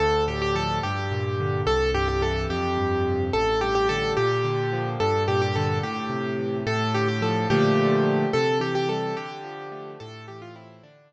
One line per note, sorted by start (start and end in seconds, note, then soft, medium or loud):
0.00 0.80 D2 loud
0.00 0.24 A4 loud
0.28 0.81 A2 medium
0.28 0.41 G4 medium
0.42 0.55 G4 loud
0.55 0.81 F3 medium
0.55 0.79 A4 loud
0.83 1.63 G2 medium
0.83 1.61 G4 medium
1.12 1.64 A#2 medium
1.40 1.66 D3 medium
1.67 2.46 C2 medium
1.67 1.91 A4 loud
1.94 2.47 G2 medium
1.94 2.08 G4 loud
2.08 2.22 G4 medium
2.21 2.47 E3 medium
2.21 2.47 A4 medium
2.50 3.29 F2 medium
2.50 3.24 G4 medium
2.77 3.30 G2 medium
3.07 3.33 C3 medium
3.33 4.13 A1 medium
3.33 3.60 A4 loud
3.61 4.15 G2 medium
3.61 3.74 G4 loud
3.75 3.88 G4 loud
3.89 4.16 D3 medium
3.89 4.13 A4 loud
4.17 4.96 A#2 medium
4.17 4.89 G4 loud
4.44 4.97 D3 medium
4.73 4.99 F3 medium
5.00 5.80 G2 medium
5.00 5.23 A4 loud
5.28 5.81 A#2 medium
5.28 5.41 G4 loud
5.42 5.55 G4 loud
5.56 5.83 D3 medium
5.56 5.78 A4 medium
5.83 6.62 A2 medium
5.83 6.57 G4 medium
6.10 6.63 C3 medium
6.39 6.65 E3 medium
6.67 7.46 A2 loud
6.67 6.94 A4 loud
6.94 7.48 D3 medium
6.94 7.08 G4 loud
7.08 7.22 G4 medium
7.22 7.48 F3 medium
7.22 7.47 A4 medium
7.50 8.25 A#2 loud
7.50 8.25 D3 medium
7.50 8.25 F3 medium
7.50 8.25 A3 medium
7.50 8.29 G4 loud
8.33 9.13 C3 medium
8.33 8.58 A4 loud
8.60 9.13 E3 medium
8.60 8.74 G4 loud
8.75 8.88 G4 loud
8.89 9.16 G3 medium
8.89 9.15 A4 medium
9.17 9.96 D3 medium
9.17 9.91 G4 medium
9.44 9.97 F3 medium
9.72 9.98 A3 medium
10.00 10.80 A2 medium
10.00 10.25 A4 loud
10.28 10.82 E3 medium
10.28 10.41 G4 medium
10.42 10.55 F4 loud
10.56 10.82 C4 medium
10.56 10.82 E4 medium
10.83 11.13 D3 medium
10.83 11.13 D4 loud
11.12 11.13 F3 medium